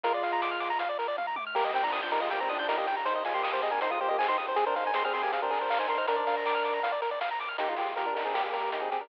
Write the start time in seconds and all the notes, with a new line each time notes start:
0.03 A#1 G#3 F4 A#4, kick, closed hi-hat
0.14 D5
0.23 A#1 F5, open hi-hat
0.33 A#5
0.41 A#1 D6, kick, snare
0.51 F6
0.60 A#1 D6, open hi-hat
0.70 A#5
0.79 A#1 F5, kick, closed hi-hat
0.89 D5
0.99 A#1 A#4, open hi-hat
1.08 D5
1.17 A#1 F5, kick, high tom
1.27 A#5
1.36 A#1 D6, high tom
1.47 F6
1.55 D#2 A#3 G4 A#4, kick, crash
1.65 D#5
1.73 D#2 D#3 C4 G5, open hi-hat
1.83 F3 D4 A#5
1.92 D#2 D#6, kick, clap
2.03 F3 D4 G6
2.11 D#2 G3 D#4 A#4, open hi-hat
2.21 G#3 F4 D#5
2.30 D#2 A#3 G4 G5, kick, closed hi-hat
2.40 D#3 C4 A#5
2.49 D#2 F3 D4 D#6, open hi-hat
2.59 F3 D4 G6
2.68 D#2 G3 D#4 A#4, kick, snare
2.78 A#3 G4 D#5
2.87 D#2 G5, open hi-hat
2.97 A#5
3.05 D#2 D#4 C5, kick, closed hi-hat
3.15 D#5
3.25 D#2 G#3 F4 G#5, open hi-hat
3.34 A#3 G4 C6
3.43 D#2 D#6, kick, clap
3.52 A#3 G4 C5
3.62 D#2 C4 G#4 D#5, open hi-hat
3.71 D4 A#4 G#5
3.81 D#2 D#4 C5 C6, kick, closed hi-hat
3.90 G#3 F4 D#6
4.00 D#2 A#3 G4 C5
4.08 A#3 G4 D#5
4.19 F#2 C4 G#4 G#5, kick, clap
4.28 D#4 C5 C6
4.38 G2 D#6, open hi-hat
4.48 C5
4.56 G#1 C4 G#4, kick, closed hi-hat
4.66 D4 A#4 C5
4.76 G#1 D#4 C5 F5, open hi-hat
4.87 G#5
4.94 G#1 C4 G#4 C6, kick, snare
5.04 C4 G#4 F6
5.13 G#1 C4 G#4 C6, open hi-hat
5.23 A#3 G4 G#5
5.32 G#1 C4 G#4 F5, kick, closed hi-hat
5.42 D4 A#4 C5
5.51 G#1 G#4, open hi-hat
5.61 C5
5.70 G#1 F5, kick, clap
5.78 D#4 C5 G#5
5.88 G#1 D4 A#4 C6, open hi-hat
5.98 D#4 C5 F6
6.07 A#1 D4 A#4, kick, closed hi-hat
6.16 D5
6.27 A#1 F5, open hi-hat
6.37 A#5
6.45 A#1 D6, kick, clap
6.55 F6
6.64 A#1 D6, open hi-hat
6.74 A#5
6.83 A#1 F5, kick, closed hi-hat
6.92 D5
7.02 A#1 A#4, open hi-hat
7.11 D5
7.21 A#1 F5, kick, snare
7.31 A#5
7.39 A#1 D6, open hi-hat
7.48 F6
7.58 A#3 D#4 G4, kick, closed hi-hat
7.69 G#3 F4
7.76 G#3 F4 G4, open hi-hat
7.96 A#3 G4 A#4, kick, closed hi-hat
8.06 D4 A#4
8.15 D4 D#4 A#4, open hi-hat
8.25 C4 G#4
8.34 A#3 G4, kick, snare
8.44 A#3 G4
8.53 A#4, open hi-hat
8.72 D#4, kick, closed hi-hat
8.81 C4 G#4
8.91 C4 G4 G#4, open hi-hat
9.01 D4 A#4